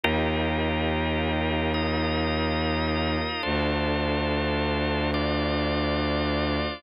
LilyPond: <<
  \new Staff \with { instrumentName = "Drawbar Organ" } { \time 3/4 \key d \phrygian \tempo 4 = 53 <ees' f' g' bes'>4. <ees' f' bes' ees''>4. | <d' f' a' c''>4. <d' f' c'' d''>4. | }
  \new Staff \with { instrumentName = "Violin" } { \clef bass \time 3/4 \key d \phrygian ees,2. | d,2. | }
>>